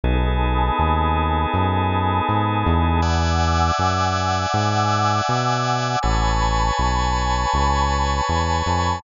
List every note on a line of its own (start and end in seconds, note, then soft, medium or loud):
0.03 0.71 B1 medium
0.03 3.01 B3 medium
0.03 3.01 D#4 medium
0.03 3.01 G#4 medium
0.03 3.01 A4 medium
0.03 3.00 G#5 medium
0.03 3.00 A5 medium
0.03 3.00 B5 medium
0.03 3.00 D#6 medium
0.79 1.46 D#2 medium
1.54 2.21 F#2 medium
2.29 2.64 G#2 medium
2.66 3.71 E2 medium
3.02 5.99 D5 medium
3.02 5.99 E5 medium
3.02 5.99 F#5 medium
3.02 6.01 F#5 medium
3.02 5.99 G#5 medium
3.02 6.01 G#5 medium
3.02 6.01 D6 medium
3.02 6.01 E6 medium
3.79 4.46 F#2 medium
4.54 5.21 G#2 medium
5.29 5.96 B2 medium
6.03 6.71 A1 medium
6.03 9.00 B4 medium
6.03 9.00 C#5 medium
6.03 9.00 G#5 medium
6.03 9.00 A5 medium
6.03 9.00 B5 medium
6.03 9.00 C#6 medium
6.79 7.46 B1 medium
7.54 8.21 C#2 medium
8.29 8.62 E2 medium
8.66 9.00 F2 medium